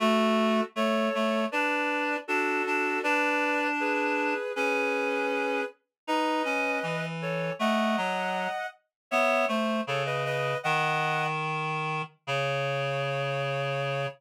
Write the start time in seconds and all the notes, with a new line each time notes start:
0.00 A3 F#4 A4
0.76 A3 A4 C#5
1.15 A3
1.52 D4 B4 D5
2.28 D4 F#4 A4
2.67 D4
3.03 D4 B4 D5
3.80 G#4 B4
4.56 C#4 G#4 B4
6.07 D#4 B4 D#5
6.45 C#4
6.83 E3
7.22 A4 C#5
7.59 A3 D#5 F#5
7.97 F#3
9.11 B3 C#5 E5
9.48 A3 C5
9.87 C#3 A4 C#5
10.06 B4 D#5
10.25 B4 D#5
10.63 D#3 D#5 F#5
12.27 C#3 C#5